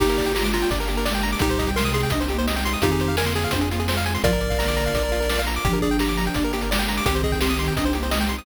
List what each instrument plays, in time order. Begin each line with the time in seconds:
0.00 synth bass 1 G1, pad 5 (bowed) A#3 D4 G4, ocarina A#3 G4, lead 1 (square) D#4 G4, kick, crash
0.09 lead 1 (square) A#4, closed hi-hat
0.18 lead 1 (square) D5, kick, closed hi-hat
0.25 lead 1 (square) G5, closed hi-hat
0.35 ocarina G#3 F4, lead 1 (square) G4 A#5, snare
0.44 lead 1 (square) D6, closed hi-hat
0.53 lead 1 (square) F4 A#5, closed hi-hat
0.62 lead 1 (square) G5, closed hi-hat
0.71 synth bass 1 G1, ocarina D4, lead 1 (square) D5, kick, closed hi-hat
0.80 lead 1 (square) A#4, closed hi-hat
0.88 ocarina A#3, lead 1 (square) G4, closed hi-hat
0.97 lead 1 (square) A#4, closed hi-hat
1.05 ocarina G#3, lead 1 (square) D5, snare
1.13 lead 1 (square) G5, closed hi-hat
1.23 lead 1 (square) A#5, closed hi-hat
1.32 lead 1 (square) D6, closed hi-hat
1.39 synth bass 1 C2, ocarina A#2 G3, pad 5 (bowed) C4 D#4 G4, lead 1 (square) D#4 G4, kick, closed hi-hat
1.49 lead 1 (square) C5, closed hi-hat
1.59 lead 1 (square) D#5, kick, closed hi-hat
1.67 lead 1 (square) G5, kick, closed hi-hat
1.76 ocarina C3 G#3, lead 1 (square) A#4 C6, snare
1.85 lead 1 (square) D#6, closed hi-hat
1.94 lead 1 (square) G#4 C6, closed hi-hat
2.03 lead 1 (square) G5, closed hi-hat
2.10 synth bass 1 C2, ocarina D4, lead 1 (square) D#5, kick, closed hi-hat
2.20 lead 1 (square) C5, closed hi-hat
2.29 ocarina A#3, lead 1 (square) G4, closed hi-hat
2.38 lead 1 (square) C5, closed hi-hat
2.47 ocarina G#3, lead 1 (square) D#5, snare
2.56 lead 1 (square) G5, closed hi-hat
2.65 lead 1 (square) C6, closed hi-hat
2.73 lead 1 (square) D#6, closed hi-hat
2.82 synth bass 1 F2, ocarina D#3 C4, pad 5 (bowed) C4 F4 G#4, lead 1 (square) D#4 F4 G4, kick, closed hi-hat
2.91 lead 1 (square) G#4, closed hi-hat
3.00 lead 1 (square) C5, closed hi-hat
3.08 lead 1 (square) F5, closed hi-hat
3.17 ocarina D3 A#3, lead 1 (square) A#4 G#5, snare
3.26 lead 1 (square) C6, closed hi-hat
3.35 lead 1 (square) G#4 G#5, closed hi-hat
3.43 lead 1 (square) F5, closed hi-hat
3.51 synth bass 1 F2, ocarina D4, lead 1 (square) C5, kick, closed hi-hat
3.61 lead 1 (square) G#4, closed hi-hat
3.70 ocarina A#3, lead 1 (square) F4, closed hi-hat
3.79 lead 1 (square) G#4, closed hi-hat
3.88 ocarina G#3, lead 1 (square) C5, snare
3.97 lead 1 (square) F5, closed hi-hat
4.06 lead 1 (square) G#5, closed hi-hat
4.15 lead 1 (square) C6, closed hi-hat
4.23 synth bass 1 A#1, ocarina G#2 F3, pad 5 (bowed) A#3 D4 F4, lead 1 (square) F4 A#4 D5, kick, closed hi-hat
4.32 lead 1 (square) A#4, closed hi-hat
4.41 lead 1 (square) D5, closed hi-hat
4.50 lead 1 (square) F5, kick, closed hi-hat
4.59 ocarina D3 A#3, lead 1 (square) A#5, snare
4.68 lead 1 (square) D6, closed hi-hat
4.76 lead 1 (square) A#5, closed hi-hat
4.86 lead 1 (square) F5, closed hi-hat
4.94 synth bass 1 A#1, lead 1 (square) D5, kick, closed hi-hat
5.03 lead 1 (square) A#4
5.12 lead 1 (square) F4, closed hi-hat
5.20 lead 1 (square) A#4, closed hi-hat
5.30 lead 1 (square) D5, snare
5.38 lead 1 (square) F5, closed hi-hat
5.47 lead 1 (square) A#5, closed hi-hat
5.54 lead 1 (square) D6, closed hi-hat
5.65 synth bass 1 G1, ocarina F3 D4, pad 5 (bowed) A#3 D4 G4, lead 1 (square) G4, kick, closed hi-hat
5.73 lead 1 (square) A#4, closed hi-hat
5.81 lead 1 (square) G#4 D5, kick, closed hi-hat
5.91 lead 1 (square) G5, closed hi-hat
5.99 lead 1 (square) G4 A#5, snare
6.07 lead 1 (square) D6, closed hi-hat
6.17 lead 1 (square) A#5, closed hi-hat
6.25 lead 1 (square) G5, closed hi-hat
6.34 synth bass 1 G1, ocarina D4, lead 1 (square) D5, kick, closed hi-hat
6.42 lead 1 (square) A#4, closed hi-hat
6.52 ocarina A#3, lead 1 (square) G4, closed hi-hat
6.61 lead 1 (square) A#4, closed hi-hat
6.70 ocarina G#3, lead 1 (square) D5, snare
6.78 lead 1 (square) G5, closed hi-hat
6.88 lead 1 (square) A#5, closed hi-hat
6.97 lead 1 (square) D6, closed hi-hat
7.06 synth bass 1 C2, ocarina D#3 C4, pad 5 (bowed) C4 D#4 G4, lead 1 (square) G4, kick, closed hi-hat
7.15 lead 1 (square) C5, closed hi-hat
7.23 lead 1 (square) G#4 D#5, kick, closed hi-hat
7.32 lead 1 (square) G5, kick, closed hi-hat
7.41 lead 1 (square) G4 C6, snare
7.50 lead 1 (square) D#6, closed hi-hat
7.59 lead 1 (square) C6, closed hi-hat
7.66 lead 1 (square) G5, closed hi-hat
7.76 synth bass 1 C2, ocarina D4, lead 1 (square) D#5, kick, closed hi-hat
7.85 lead 1 (square) C5, closed hi-hat
7.93 ocarina A#3, lead 1 (square) G4, closed hi-hat
8.03 lead 1 (square) C5, closed hi-hat
8.11 ocarina G#3, lead 1 (square) D#5, snare
8.20 lead 1 (square) G5, closed hi-hat
8.29 lead 1 (square) C6, closed hi-hat
8.38 lead 1 (square) D#6, closed hi-hat